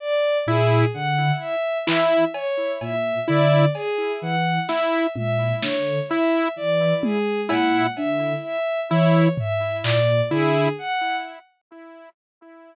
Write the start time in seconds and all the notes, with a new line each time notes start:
0.00 D5
0.46 A#2 E4 G#4
0.94 D3 F#5
1.41 E5
1.86 E3 E4 E5, clap
2.34 C#5, cowbell
2.81 A#2 E5, cowbell
3.27 D3 E4 D5
3.74 G#4, cowbell
4.22 E3 F#5
4.68 E4 E5, snare
5.15 A#2 E5, high tom
5.61 D3 C#5, snare
6.09 E4 E5
6.56 E3 D5
7.03 G#4, high tom
7.48 A#2 E4 F#5, cowbell
7.96 D3 E5, cowbell
8.43 E5
8.90 E3 E4 C#5
9.38 E5, floor tom
9.83 A#2 D5, clap
10.31 D3 E4 G#4
10.78 F#5